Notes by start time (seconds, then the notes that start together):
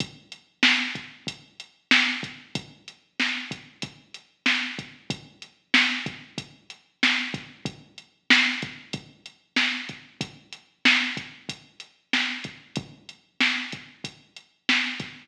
0.00 kick, closed hi-hat
0.32 closed hi-hat
0.63 snare
0.95 kick, closed hi-hat
1.27 kick, closed hi-hat
1.60 closed hi-hat
1.91 snare
2.23 kick, closed hi-hat
2.55 kick, closed hi-hat
2.88 closed hi-hat
3.20 snare
3.51 kick, closed hi-hat
3.82 kick, closed hi-hat
4.14 closed hi-hat
4.46 snare
4.79 kick, closed hi-hat
5.10 kick, closed hi-hat
5.42 closed hi-hat
5.74 snare
6.06 kick, closed hi-hat
6.38 kick, closed hi-hat
6.70 closed hi-hat
7.03 snare
7.34 kick, closed hi-hat
7.65 kick, closed hi-hat
7.98 closed hi-hat
8.30 snare
8.62 kick, closed hi-hat
8.93 kick, closed hi-hat
9.26 closed hi-hat
9.56 snare
9.89 kick, closed hi-hat
10.21 kick, closed hi-hat
10.53 closed hi-hat
10.85 snare
11.17 kick, closed hi-hat
11.49 kick, closed hi-hat
11.80 closed hi-hat
12.13 snare
12.44 kick, closed hi-hat
12.76 kick, closed hi-hat
13.09 closed hi-hat
13.41 snare
13.72 kick, closed hi-hat
14.04 kick, closed hi-hat
14.36 closed hi-hat
14.69 snare
15.00 kick, snare, closed hi-hat